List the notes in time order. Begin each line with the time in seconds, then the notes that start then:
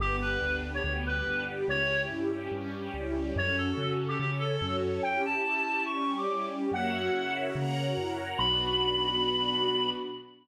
0.00 G1 B3 D4 G4
0.21 G4 B4
0.42 D2 D4
0.63 G4
0.74 C#5
0.83 D2 G3 B3 G4 C#5
1.05 G4 B4
1.25 G1 D4
1.47 G4
1.68 C#2 C#4 E4 G4 C#5
1.89 G4
2.08 G2 E4
2.31 G4
2.51 G2 G3 C#4 G4
2.73 G4
2.94 C#2 E4
3.16 G4
3.35 F#2 C#4 F#4 A4 C#5
3.56 A4
3.78 C#3 F#4
3.98 A4
4.08 G4
4.20 C#3 C#4 G4 A4 C#5
4.39 A4
4.62 F#2 F#4
4.84 A4
5.02 C#4 E4 G4 G5
5.24 G4 A5
5.45 E4
5.66 G4
5.85 G3 C#4 G4 C#6
6.08 G4
6.17 D6
6.30 E4
6.51 G4
6.71 F#2 A#3 A#4 C#5 E5 F#5
6.91 F#4
7.13 C#3 E4
7.34 F#4
7.55 C#3 A#3 A#4 C#5 F#5 A#5
7.76 F#4
7.97 F#2 E4
8.20 F#4
8.38 B1 B3 D4 F#4 B5